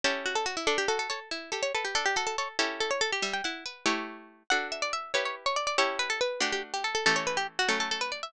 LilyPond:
<<
  \new Staff \with { instrumentName = "Harpsichord" } { \time 6/8 \key d \major \partial 4. \tempo 4. = 94 r8 fis'16 a'16 fis'16 e'16 | a'16 g'16 a'16 a'16 cis''16 r8. a'16 cis''16 a'16 g'16 | a'16 g'16 a'16 a'16 cis''16 r8. a'16 cis''16 a'16 g'16 | e''16 g''16 fis''4. r4 |
fis''8 e''16 d''16 e''8 cis''16 cis''16 r16 cis''16 d''16 d''16 | cis''8 b'16 a'16 b'8 g'16 g'16 r16 g'16 a'16 a'16 | a'16 cis''16 b'16 g'16 r16 fis'16 a'16 a'16 a'16 b'16 d''16 e''16 | }
  \new Staff \with { instrumentName = "Harpsichord" } { \time 6/8 \key d \major \partial 4. <cis' e' g' a'>4. | d'8 fis'8 a'8 e'8 g'8 b'8 | d'8 fis'8 a'8 <cis' e' g' a'>4. | g8 e'8 b'8 <a e' g' cis''>4. |
<d' fis' a'>4. <e' g' b'>4. | <cis' e' g' a'>4. <a d' fis'>4. | <e a cis' g'>4. <fis a cis'>4. | }
>>